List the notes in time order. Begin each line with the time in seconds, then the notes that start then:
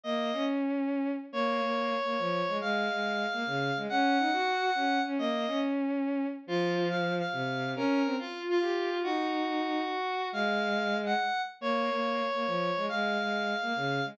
0.03 A#3 D#5
0.33 C#4
1.32 A#3 C#5
1.62 A#3
2.05 A#3
2.18 F3
2.48 G#3
2.61 G#3 F5
2.91 G#3
3.33 A#3
3.46 C#3
3.77 G#3
3.89 C#4 F#5
4.19 D#4
4.32 F#4
4.75 C#4
5.05 C#4
5.18 A#3 D#5
5.47 C#4
6.47 F3 F4
6.89 F5
7.19 F5
7.32 C3
7.76 C#4 A#4
8.05 C4
8.18 F4
8.49 F4
8.61 G4
8.90 F4
9.03 D#4 F#4
9.90 F#4
10.32 G#3 F5
11.06 F#5
11.61 A#3 C#5
11.91 A#3
12.34 A#3
12.46 F3
12.77 G#3
12.89 G#3 F5
13.19 G#3
13.62 A#3
13.76 C#3
14.05 G#3